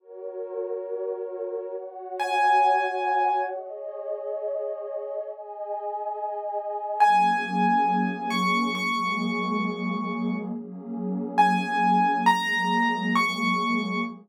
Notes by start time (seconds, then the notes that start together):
0.00 F#4 A#4 C#5
1.75 F#4 C#5 F#5
2.20 G#5
3.50 G#4 C#5 D#5
5.26 G#4 D#5 G#5
7.00 F#3 A#3 C#4 G#4 G#5
8.30 C#6
8.75 F#3 G#3 A#3 G#4 C#6
10.51 F#3 A#3 C#4 G#4
11.38 G#5
12.26 F#3 G#3 A#3 G#4 A#5
13.16 C#6